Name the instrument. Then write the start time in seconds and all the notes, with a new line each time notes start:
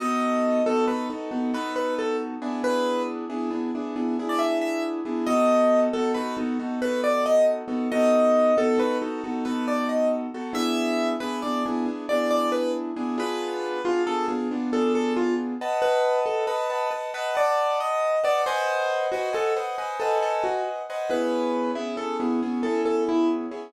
acoustic grand piano
0.00 B3 D#4 F#4 A4 D#5
0.66 B3 D#4 F#4 A4
0.88 B3 D#4 F#4 A4 B4
1.10 B3 D#4 F#4 A4
1.31 B3 D#4 F#4 A4
1.54 B3 D#4 F#4 A4 B4
1.76 B4
1.99 A4
2.42 B3 D4 E4 G#4
2.64 B4
3.30 B3 D4 E4 G#4
3.50 B3 D4 E4 G#4
3.75 B3 D4 E4 G#4
3.96 B3 D4 E4 G#4
4.19 B3 D4 E4 G#4
4.29 D5
4.39 E5
4.61 E5
5.05 B3 D4 E4 G#4
5.26 B3 D#4 F#4 A4 D#5
5.93 B3 D#4 F#4 A4
6.14 B3 D#4 F#4 A4 B4
6.37 B3 D#4 F#4 A4
6.59 B3 D#4 F#4 A4
6.82 B3 D#4 F#4 A4 B4
7.04 D5
7.26 D#5
7.68 B3 D#4 F#4 A4
7.92 B3 D#4 F#4 A4 D#5
8.57 B3 D#4 F#4 A4
8.78 B3 D#4 F#4 A4 B4
9.02 B3 D#4 F#4 A4
9.24 B3 D#4 F#4 A4
9.45 B3 D#4 F#4 A4 B4
9.68 D5
9.89 D#5
10.34 B3 D#4 F#4 A4
10.53 B3 D4 E4 G#4 E5
11.20 B3 D4 E4 G#4 B4
11.42 B3 D4 E4 G#4 D5
11.66 B3 D4 E4 G#4
11.86 B3 D4 E4 G#4
12.09 B3 D4 E4 G#4 D5
12.31 D5
12.52 B4
12.96 B3 D4 E4 G#4
13.18 B3 D4 F4 G#4 B4
13.84 B3 D4 F4 G#4
14.07 B3 D4 F4 G#4 A4
14.28 B3 D4 F4 G#4
14.51 B3 D4 F4 G#4
14.73 B3 D4 F4 G#4 A4
14.95 A4
15.16 F4
15.61 B4 D#5 F#5 A5
15.82 B4
16.26 A4
16.47 B4 D#5 F#5 A5
16.70 B4 D#5 F#5 A5
16.91 B4 D#5 F#5 A5
17.14 B4 D#5 F#5 A5
17.35 B4 D5 D#5 F#5 A5
17.80 D#5
18.24 B4 D5 D#5 F#5 A5
18.46 B4 C5 D#5 F#5 G#5
19.12 F#4 B4 C5 D#5 F#5 G#5
19.33 A4 B4 C5 D#5 F#5 G#5
19.56 B4 C5 D#5 F#5 G#5
19.78 B4 C5 D#5 F#5 G#5
20.00 A4 B4 C5 D#5 F#5 G#5
20.22 A4
20.44 F#4
20.90 B4 C5 D#5 F#5 G#5
21.10 B3 C#4 E4 G#4 B4
21.75 B3 C#4 E4 G#4
21.97 B3 C#4 E4 G#4 A4
22.20 B3 C#4 E4 G#4
22.42 B3 C#4 E4 G#4
22.63 B3 C#4 E4 G#4 A4
22.86 A4
23.09 E4
23.51 B3 C#4 E4 G#4